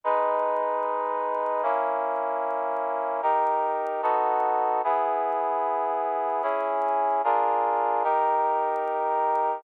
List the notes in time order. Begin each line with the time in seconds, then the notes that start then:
0.04 G#3 D#4 B4
1.63 A#3 C#4 E4
3.22 D#4 G4 A#4
4.02 B3 D#4 F#4 A4
4.84 B3 E4 G#4
6.43 C#4 E4 G#4
7.24 D4 F4 G#4 A#4
8.03 D#4 G4 A#4